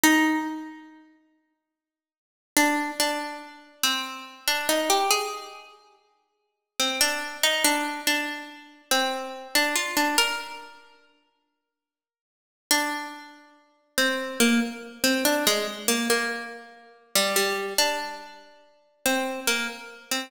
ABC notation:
X:1
M:3/4
L:1/16
Q:1/4=71
K:Bbmix
V:1 name="Pizzicato Strings"
E8 z4 | D2 D4 C3 D E G | A6 z2 C D2 E | D2 D4 C3 D F D |
B6 z6 | D6 C2 B, z2 C | D A, z B, B,4 z G, G,2 | D6 C2 B, z2 C |]